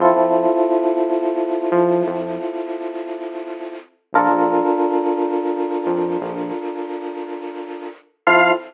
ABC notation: X:1
M:6/4
L:1/16
Q:1/4=87
K:Fmix
V:1 name="Lead 1 (square)"
z24 | z24 | f4 z20 |]
V:2 name="Electric Piano 1"
[C=EFA]24 | [DFAB]24 | [C=EFA]4 z20 |]
V:3 name="Synth Bass 1" clef=bass
F,, F,,9 F,2 F,,12 | B,,, B,,,9 F,,2 B,,,12 | F,,4 z20 |]